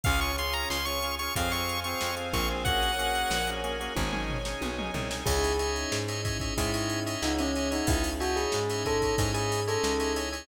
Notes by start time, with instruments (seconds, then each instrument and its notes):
0.04 electric bass (finger) C#2, drawbar organ C#4 F4 G#4, string ensemble 1 C#5 F5 G#5, lead 1 (square) F5, kick, closed hi-hat
0.21 lead 1 (square) C#6, closed hi-hat
0.38 drawbar organ C#4 F4 G#4, lead 1 (square) C6, closed hi-hat
0.53 lead 1 (square) A#5, closed hi-hat
0.70 electric bass (finger) C#2, lead 1 (square) C6, snare
0.85 drawbar organ C#4 F4 G#4, lead 1 (square) C#6, closed hi-hat
1.02 drawbar organ C#4 F4 G#4, closed hi-hat
1.19 drawbar organ C#4 F4 G#4, lead 1 (square) C#6, closed hi-hat
1.36 electric bass (finger) F2, drawbar organ C4 F4 G#4, string ensemble 1 C5 F5 G#5, lead 1 (square) F5, kick, closed hi-hat
1.52 drawbar organ C4 F4 G#4, lead 1 (square) C#6, closed hi-hat
1.69 closed hi-hat
1.84 drawbar organ C4 F4 G#4, lead 1 (square) C#6, closed hi-hat
2.01 electric bass (finger) F2, snare
2.16 drawbar organ C4 F4 G#4, closed hi-hat
2.33 electric bass (finger) A#1, drawbar organ C4 F4 G#4, lead 1 (square) C#6, kick, closed hi-hat
2.50 drawbar organ C4 F4 G#4
2.65 drawbar organ A#3 C#4 F#4 G#4, string ensemble 1 A#4 C#5 F#5 G#5, lead 1 (square) F#5, kick, closed hi-hat
2.83 closed hi-hat
2.99 drawbar organ A#3 C#4 F#4 G#4, closed hi-hat
3.15 closed hi-hat
3.30 electric bass (finger) A#1, snare
3.47 drawbar organ A#3 C#4 F#4 G#4, closed hi-hat
3.64 drawbar organ A#3 C#4 F#4 G#4, closed hi-hat
3.80 drawbar organ A#3 C#4 F#4 G#4, closed hi-hat
3.96 electric bass (finger) G#1, drawbar organ C#4 D#4 G#4, string ensemble 1 C#5 D#5 G#5, kick, high tom
4.12 drawbar organ C#4 D#4 G#4, mid tom
4.30 floor tom
4.45 drawbar organ C#4 D#4 G#4, snare
4.61 electric bass (finger) B1, high tom
4.78 drawbar organ C#4 D#4 G#4, mid tom
4.94 electric bass (finger) C2, drawbar organ C#4 D#4 G#4, floor tom
5.11 drawbar organ C#4 D#4 G#4, snare
5.26 electric bass (finger) C#2, string ensemble 1 C#4 D#4 E4 G#4, tubular bells G#4, drawbar organ C#5 D#5 E5 G#5, kick, crash
5.44 ride
5.59 drawbar organ C#5 D#5 E5 G#5, ride
5.76 ride
5.92 electric bass (finger) G#2, snare
6.08 drawbar organ C#5 D#5 E5 G#5, ride
6.25 drawbar organ C#5 D#5 E5 G#5, kick, ride
6.40 drawbar organ C#5 D#5 E5 G#5, kick, ride
6.57 electric bass (finger) G#2, tubular bells E4, drawbar organ C#5 D#5 E5 G#5, kick, ride
6.74 drawbar organ C#5 D#5 E5 G#5, ride
6.90 ride
7.06 drawbar organ C#5 D#5 E5 G#5, ride
7.22 electric bass (finger) C#2, tubular bells D#4, snare
7.38 tubular bells C#4, drawbar organ C#5 D#5 E5 G#5, ride
7.55 drawbar organ C#5 D#5 E5 G#5, ride
7.71 tubular bells D#4, drawbar organ C#5 D#5 E5 G#5, ride
7.87 electric bass (finger) C#2, tubular bells E4, kick, ride
8.04 ride
8.20 tubular bells F#4, drawbar organ C#5 D#5 E5 G#5, ride
8.36 tubular bells G#4, ride
8.52 electric bass (finger) G#2, snare
8.70 drawbar organ C#5 D#5 E5 G#5, ride
8.85 tubular bells A4, drawbar organ C#5 D#5 E5 G#5, kick, ride
9.02 drawbar organ C#5 D#5 E5 G#5, kick, ride
9.18 electric bass (finger) G#2, drawbar organ C#5 D#5 E5 G#5, kick, ride
9.34 tubular bells G#4, drawbar organ C#5 D#5 E5 G#5, ride
9.52 ride
9.67 tubular bells A4, drawbar organ C#5 D#5 E5 G#5, ride
9.84 electric bass (finger) C#2, snare
10.00 drawbar organ C#5 D#5 E5 G#5, ride
10.16 drawbar organ C#5 D#5 E5 G#5, ride
10.32 drawbar organ C#5 D#5 E5 G#5, ride